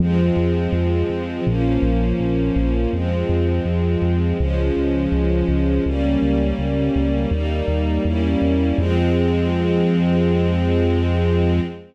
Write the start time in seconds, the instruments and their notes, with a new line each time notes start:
0.00 synth bass 1 F2, string ensemble 1 F3 G#3 C4
0.37 synth bass 1 F2
0.72 synth bass 1 F2
1.10 synth bass 1 F2
1.46 synth bass 1 A#1, string ensemble 1 F3 A#3 C#4
1.82 synth bass 1 A#1
2.20 synth bass 1 A#1
2.56 synth bass 1 A#1
2.93 synth bass 1 F2, string ensemble 1 F3 G#3 C4
3.29 synth bass 1 F2
3.65 synth bass 1 F2
4.02 synth bass 1 F2
4.39 synth bass 1 C#2, string ensemble 1 F3 G#3 C#4
4.76 synth bass 1 C#2
5.12 synth bass 1 C#2
5.48 synth bass 1 C#2
5.86 synth bass 1 C#2, string ensemble 1 G3 A#3 C#4
6.22 synth bass 1 C#2
6.59 synth bass 1 C#2
6.95 synth bass 1 C#2
7.31 synth bass 1 D#2, string ensemble 1 G3 A#3 D#4
7.68 synth bass 1 D#2
8.05 synth bass 1 E2, string ensemble 1 G3 A#3 C#4 E4
8.42 synth bass 1 E2
8.78 synth bass 1 F2, string ensemble 1 F3 G#3 C4